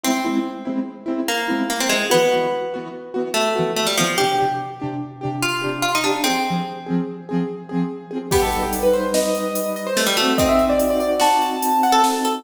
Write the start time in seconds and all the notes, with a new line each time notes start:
0.03 G#3 C4 E4
0.24 G#3 C4 E4
0.65 G#3 C4 E4
1.06 G#3 C4 E4
1.28 A#3
1.48 G#3 C4 E4
1.70 A#3
1.80 C4
1.89 G#3 C4 E4
2.10 E3 B3 F#4
2.32 E3 B3 F#4
2.74 E3 B3 F#4
3.14 E3 B3 F#4
3.34 A3
3.55 E3 B3 F#4
3.76 A3
3.86 G3
3.97 E3 F3 B3 F#4
4.18 C3 D4 G4
4.38 C3 D4 G4
4.80 C3 D4 G4
5.21 C3 D4 G4
5.42 F4
5.62 C3 D4 G4
5.82 F4
5.95 D#4
6.04 D4 G4
6.08 C3
6.24 C4 G#4
6.29 F3
6.46 F3 C4 G#4
6.86 F3 C4 G#4
7.29 F3 C4 G#4
7.69 F3 C4 G#4
8.11 F3 C4 G#4
8.31 G3 B3 D#4 G4 B4, kick, crash
8.42 A4
8.52 closed hi-hat
8.62 G4
8.73 closed hi-hat
8.83 B4
8.93 C5, closed hi-hat
9.14 D#5, snare
9.35 closed hi-hat
9.55 closed hi-hat
9.76 D#5, closed hi-hat
9.87 C5
9.97 A3, snare
10.06 G3
10.17 A3 D#4 F#4, closed hi-hat
10.21 C4
10.38 C4 D#5, kick, closed hi-hat
10.49 E5
10.59 closed hi-hat
10.69 D5
10.79 closed hi-hat
10.90 D5
11.00 D5, closed hi-hat
11.20 F#4 A5, snare
11.42 closed hi-hat
11.62 closed hi-hat
11.83 F#5, closed hi-hat
11.92 A4 A5
12.04 snare
12.24 A4, closed hi-hat